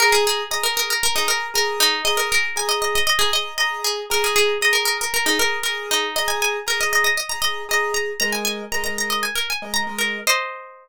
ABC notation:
X:1
M:4/4
L:1/16
Q:1/4=117
K:Ab
V:1 name="Pizzicato Strings"
B A A2 e B B B B E B2 B2 E2 | e B B2 a e e e e A e2 e2 A2 | B A A2 e B B B B E B2 B2 E2 | e a a2 B e e e e b e2 e2 b2 |
b a a2 b b b e a B a2 b2 B2 | [ce]14 z2 |]
V:2 name="Acoustic Grand Piano"
[Abe']4 [Abe']5 [Abe']3 [Abe']4 | [Abe']4 [Abe']5 [Abe']3 [Abe']4 | [Abe']4 [Abe']5 [Abe']3 [Abe']4 | [Abe']4 [Abe']5 [Abe']3 [Abe']4 |
[A,Be]4 [A,Be] [A,Be]6 [A,Be]2 [A,Be]3 | z16 |]